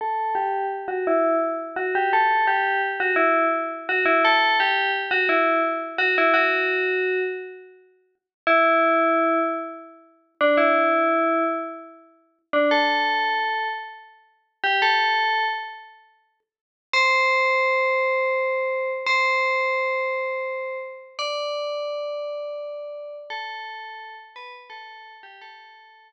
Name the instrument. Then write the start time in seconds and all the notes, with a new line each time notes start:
tubular bells
0.01 A4
0.35 G4
0.88 F#4
1.07 E4
1.76 F#4
1.95 G4
2.13 A4
2.47 G4
3.00 F#4
3.16 E4
3.89 F#4
4.05 E4
4.25 A4
4.60 G4
5.11 F#4
5.29 E4
5.98 F#4
6.18 E4
6.34 F#4
8.47 E4
10.41 D4
10.57 E4
12.53 D4
12.71 A4
14.64 G4
14.82 A4
16.93 C5
19.06 C5
21.19 D5
23.30 A4
24.36 B4
24.70 A4
25.23 G4
25.41 A4